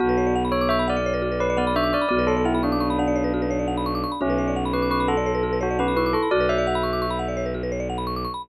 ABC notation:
X:1
M:12/8
L:1/16
Q:3/8=114
K:Bdor
V:1 name="Tubular Bells"
F4 z2 c2 e2 d6 B2 d2 e2 d2 | d2 A2 E2 D4 D14 | C4 z2 B2 B2 A6 F2 B2 B2 A2 | d2 e12 z10 |]
V:2 name="Vibraphone"
B,12 z6 B,2 D4 | B,8 B,8 z8 | C12 z6 C2 E4 | F10 z14 |]
V:3 name="Marimba"
F B c d f b c' d' c' b f d c B F B c d f b c' d' c' b | F B c d f b c' d' c' b f d c B F B c d f b c' d' c' b | F B c d f b c' d' c' b f d c B F B c d f b c' d' c' b | F B c d f b c' d' c' b f d c B F B c d f b c' d' c' b |]
V:4 name="Violin" clef=bass
B,,,24 | B,,,24 | B,,,24 | B,,,24 |]